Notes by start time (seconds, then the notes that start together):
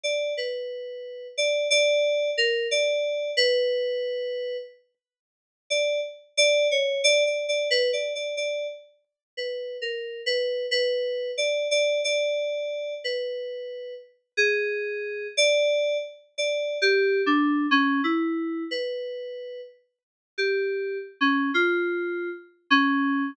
0.03 D5
0.37 B4
1.38 D5
1.70 D5
2.38 A#4
2.71 D5
3.37 B4
5.70 D5
6.37 D5
6.71 C#5
7.04 D5
7.26 D5
7.48 D5
7.71 B4
7.93 D5
8.15 D5
8.37 D5
9.37 B4
9.82 A#4
10.26 B4
10.71 B4
11.38 D5
11.71 D5
12.04 D5
13.04 B4
14.37 G#4
15.37 D5
16.38 D5
16.82 G4
17.26 D4
17.71 C#4
18.04 E4
18.71 B4
20.38 G4
21.21 C#4
21.54 F4
22.70 C#4